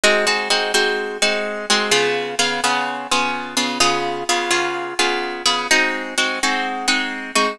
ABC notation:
X:1
M:4/4
L:1/8
Q:1/4=127
K:Ab
V:1 name="Acoustic Guitar (steel)"
[A,CE_G] [A,CEG] [A,CEG] [A,CEG]2 [A,CEG]2 [A,CEG] | [D,_CFA]2 [D,CFA] [D,CFA]2 [D,CFA]2 [D,CFA] | [D,_CFA]2 [D,CFA] [D,CFA]2 [D,CFA]2 [D,CFA] | [A,CE_G]2 [A,CEG] [A,CEG]2 [A,CEG]2 [A,CEG] |]